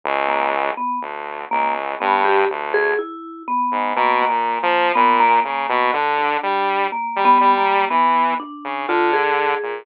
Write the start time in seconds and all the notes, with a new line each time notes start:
0.04 C#2
0.28 A#3
0.77 B3
1.01 D2
1.51 C#2 A#3
2.00 G2 B3
2.25 G4
2.50 D2
2.74 G#4
2.99 E4
3.48 B3
3.72 G#2
3.96 B2 A#3
4.22 A#3
4.29 A#2
4.63 F3
4.95 A#2 B3
5.20 A#3
5.44 C#3 A#3
5.69 B2
5.93 D3
6.18 D4
6.43 G3
6.92 A#3
7.16 G3
7.25 B3
7.41 G3
7.58 A#3
7.90 E3 B3
8.40 D4
8.64 C#3
8.88 D3 F4
9.13 G#4
9.63 A#2